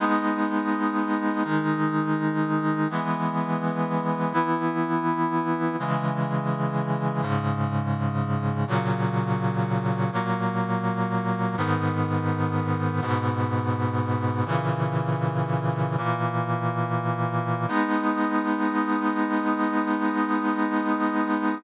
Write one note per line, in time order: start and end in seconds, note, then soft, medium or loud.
0.00 1.43 G#3 loud
0.00 1.43 B3 medium
0.00 1.43 D#4 medium
1.45 2.88 D#3 medium
1.45 2.88 G#3 medium
1.45 2.88 D#4 medium
2.90 4.33 E3 medium
2.90 4.33 G#3 medium
2.90 4.33 B3 medium
4.33 5.76 E3 medium
4.33 5.76 B3 medium
4.33 5.76 E4 medium
5.79 7.21 C#3 medium
5.79 7.22 E3 medium
5.79 7.21 G#3 medium
7.22 8.65 G#2 medium
7.22 8.65 C#3 medium
7.22 8.65 G#3 medium
8.67 10.11 A#2 loud
8.67 10.11 C#3 medium
8.67 10.11 F#3 medium
10.12 11.56 A#2 medium
10.12 11.56 F#3 medium
10.12 11.56 A#3 loud
11.57 13.00 G#2 medium
11.57 13.00 D#3 medium
11.57 13.00 B3 medium
13.01 14.44 G#2 loud
13.01 14.44 B2 medium
13.01 14.44 B3 medium
14.45 15.96 A#2 medium
14.45 15.96 C#3 medium
14.45 15.96 E3 medium
15.98 17.66 A#2 medium
15.98 17.66 E3 medium
15.98 17.66 A#3 medium
17.68 21.55 G#3 loud
17.68 21.55 B3 loud
17.68 21.55 D#4 loud